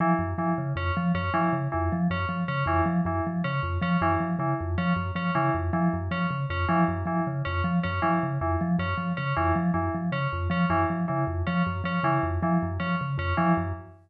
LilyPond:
<<
  \new Staff \with { instrumentName = "Vibraphone" } { \clef bass \time 6/4 \tempo 4 = 157 f8 ges,8 f8 des8 f,8 f8 ges,8 f8 des8 f,8 f8 ges,8 | f8 des8 f,8 f8 ges,8 f8 des8 f,8 f8 ges,8 f8 des8 | f,8 f8 ges,8 f8 des8 f,8 f8 ges,8 f8 des8 f,8 f8 | ges,8 f8 des8 f,8 f8 ges,8 f8 des8 f,8 f8 ges,8 f8 |
des8 f,8 f8 ges,8 f8 des8 f,8 f8 ges,8 f8 des8 f,8 | f8 ges,8 f8 des8 f,8 f8 ges,8 f8 des8 f,8 f8 ges,8 | }
  \new Staff \with { instrumentName = "Tubular Bells" } { \time 6/4 e8 r8 e8 r8 des'8 r8 des'8 e8 r8 e8 r8 des'8 | r8 des'8 e8 r8 e8 r8 des'8 r8 des'8 e8 r8 e8 | r8 des'8 r8 des'8 e8 r8 e8 r8 des'8 r8 des'8 e8 | r8 e8 r8 des'8 r8 des'8 e8 r8 e8 r8 des'8 r8 |
des'8 e8 r8 e8 r8 des'8 r8 des'8 e8 r8 e8 r8 | des'8 r8 des'8 e8 r8 e8 r8 des'8 r8 des'8 e8 r8 | }
>>